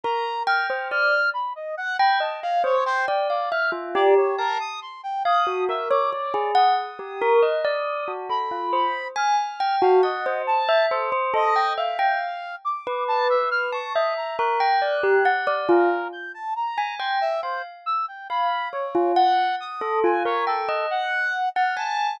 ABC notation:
X:1
M:9/8
L:1/16
Q:3/8=46
K:none
V:1 name="Tubular Bells"
^A z g c d z4 g ^d f | c g d f e F G2 a z3 f ^F ^A ^c c ^G | ^f z G ^A ^d =d2 ^F =A =F c z ^g z =g ^F f c | z e c c A g e g z3 B4 a e2 |
^A g d G ^f d =F z4 ^g =g z =f z3 | f2 ^c F ^f2 z A =F ^A g ^d z3 ^f ^g2 |]
V:2 name="Brass Section"
^a2 f' f' f'2 b ^d ^f b =a =f | ^c =c g d f' z d ^c ^A ^d' =c' g d'2 e =d' d2 | ^d'8 b4 f'3 f ^d2 | a2 A z ^d2 f4 =d'2 a e f' ^c' ^d ^a |
^f'6 ^A2 g' =a ^a2 c' e c z e' g | b2 ^c2 ^f2 ^d'2 ^g c A2 f3 =f' a2 |]